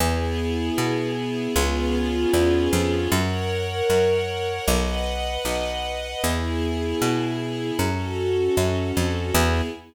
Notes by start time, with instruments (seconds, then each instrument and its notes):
0.00 electric bass (finger) E2, string ensemble 1 B3 E4 G#4
0.78 electric bass (finger) B2
1.56 electric bass (finger) C#2, string ensemble 1 B3 C#4 F4 G#4
2.33 electric bass (finger) E2
2.73 electric bass (finger) F2
3.12 electric bass (finger) F#2, string ensemble 1 A#4 C#5 F#5
3.90 electric bass (finger) F#2
4.68 electric bass (finger) B1, string ensemble 1 B4 D#5 F#5
5.45 electric bass (finger) B1
6.23 electric bass (finger) E2, string ensemble 1 B3 E4 G#4
7.02 electric bass (finger) B2
7.79 electric bass (finger) F#2, string ensemble 1 C#4 F#4 A4
8.57 electric bass (finger) F#2
8.97 electric bass (finger) F2
9.34 electric bass (finger) E2, string ensemble 1 B3 E4 G#4